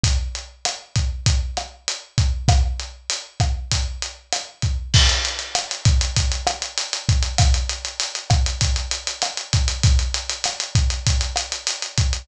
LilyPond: \new DrumStaff \drummode { \time 4/4 \tempo 4 = 98 <hh bd>8 hh8 <hh ss>8 <hh bd>8 <hh bd>8 <hh ss>8 hh8 <hh bd>8 | <hh bd ss>8 hh8 hh8 <hh bd ss>8 <hh bd>8 hh8 <hh ss>8 <hh bd>8 | <cymc bd>16 hh16 hh16 hh16 <hh ss>16 hh16 <hh bd>16 hh16 <hh bd>16 hh16 <hh ss>16 hh16 hh16 hh16 <hh bd>16 hh16 | <hh bd ss>16 hh16 hh16 hh16 hh16 hh16 <hh bd ss>16 hh16 <hh bd>16 hh16 hh16 hh16 <hh ss>16 hh16 <hh bd>16 hh16 |
<hh bd>16 hh16 hh16 hh16 <hh ss>16 hh16 <hh bd>16 hh16 <hh bd>16 hh16 <hh ss>16 hh16 hh16 hh16 <hh bd>16 hh16 | }